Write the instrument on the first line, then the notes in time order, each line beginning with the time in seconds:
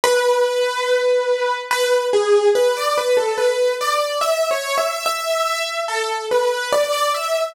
acoustic grand piano
0.04 B4
1.71 B4
2.13 G#4
2.55 B4
2.76 D5
2.97 B4
3.17 A4
3.37 B4
3.81 D5
4.21 E5
4.51 C#5
4.77 E5
5.06 E5
5.88 A4
6.31 B4
6.72 D5
6.92 D5
7.14 E5